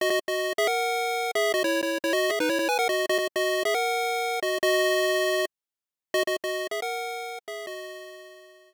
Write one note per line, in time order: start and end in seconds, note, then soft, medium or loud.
0.01 0.10 F#4 medium
0.01 0.10 D#5 loud
0.10 0.19 F#4 medium
0.10 0.19 D#5 loud
0.28 0.53 F#4 medium
0.28 0.53 D#5 medium
0.58 0.67 G#4 loud
0.58 0.67 E5 loud
0.67 1.31 A#4 medium
0.67 1.31 F#5 medium
1.35 1.52 G#4 medium
1.35 1.52 E5 loud
1.54 1.63 F#4 medium
1.54 1.63 D#5 loud
1.64 1.81 E4 medium
1.64 1.81 C#5 loud
1.83 1.98 E4 medium
1.83 1.98 C#5 medium
2.04 2.13 E4 medium
2.04 2.13 C#5 medium
2.13 2.31 F#4 medium
2.13 2.31 D#5 loud
2.30 2.39 G#4 medium
2.30 2.39 E5 medium
2.40 2.49 D#4 medium
2.40 2.49 B4 loud
2.49 2.58 E4 medium
2.49 2.58 C#5 medium
2.59 2.68 E4 medium
2.59 2.68 C#5 medium
2.69 2.78 B4 medium
2.69 2.78 G#5 loud
2.79 2.88 A#4 medium
2.79 2.88 F#5 loud
2.89 3.06 F#4 medium
2.89 3.06 D#5 medium
3.09 3.18 F#4 loud
3.09 3.18 D#5 loud
3.18 3.28 F#4 medium
3.18 3.28 D#5 medium
3.36 3.63 F#4 medium
3.36 3.63 D#5 loud
3.65 3.74 G#4 medium
3.65 3.74 E5 loud
3.74 4.40 A#4 medium
3.74 4.40 F#5 medium
4.43 4.58 F#4 medium
4.43 4.58 D#5 medium
4.63 5.45 F#4 loud
4.63 5.45 D#5 loud
6.14 6.23 F#4 loud
6.14 6.23 D#5 loud
6.27 6.36 F#4 medium
6.27 6.36 D#5 medium
6.44 6.67 F#4 medium
6.44 6.67 D#5 medium
6.71 6.80 G#4 medium
6.71 6.80 E5 medium
6.82 7.39 A#4 medium
6.82 7.39 F#5 medium
7.48 7.66 G#4 medium
7.48 7.66 E5 loud
7.67 8.74 F#4 medium
7.67 8.74 D#5 loud